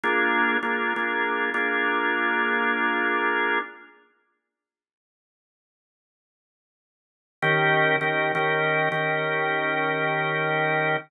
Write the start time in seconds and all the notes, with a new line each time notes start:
0.03 A#3 D4 F4 G#4
0.63 A#3 D4 F4 G#4
0.96 A#3 D4 F4 G#4
1.54 A#3 D4 F4 G#4
7.42 D#3 C#4 G4 A#4
8.01 D#3 C#4 G4 A#4
8.35 D#3 C#4 G4 A#4
8.92 D#3 C#4 G4 A#4